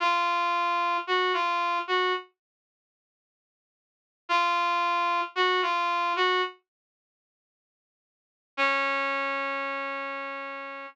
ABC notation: X:1
M:4/4
L:1/16
Q:1/4=56
K:Db
V:1 name="Brass Section"
F4 G F2 G z8 | F4 G F2 G z8 | D10 z6 |]